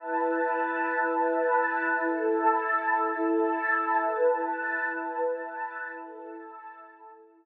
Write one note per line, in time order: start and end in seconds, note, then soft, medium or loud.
0.00 1.97 E4 medium
0.00 1.97 B4 medium
0.00 1.97 A5 medium
1.99 3.97 E4 medium
1.99 3.97 A4 medium
1.99 3.97 A5 medium
4.00 5.98 E4 medium
4.00 5.98 B4 medium
4.00 5.98 A5 medium
6.00 7.45 E4 medium
6.00 7.45 A4 medium
6.00 7.45 A5 medium